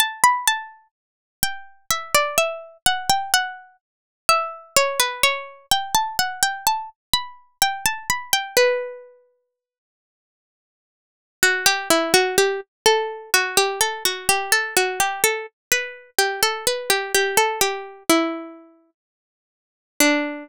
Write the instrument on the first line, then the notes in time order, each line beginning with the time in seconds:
harpsichord
0.00 A5
0.24 B5
0.47 A5
1.43 G5
1.90 E5
2.14 D5
2.38 E5
2.86 F#5
3.10 G5
3.34 F#5
4.29 E5
4.76 C#5
5.00 B4
5.23 C#5
5.71 G5
5.95 A5
6.19 F#5
6.43 G5
6.67 A5
7.13 B5
7.62 G5
7.86 A5
8.10 B5
8.33 G5
8.57 B4
11.43 F#4
11.66 G4
11.90 E4
12.14 F#4
12.38 G4
12.86 A4
13.34 F#4
13.57 G4
13.81 A4
14.05 F#4
14.29 G4
14.52 A4
14.77 F#4
15.00 G4
15.24 A4
15.72 B4
16.18 G4
16.43 A4
16.67 B4
16.90 G4
17.14 G4
17.37 A4
17.61 G4
18.10 E4
20.00 D4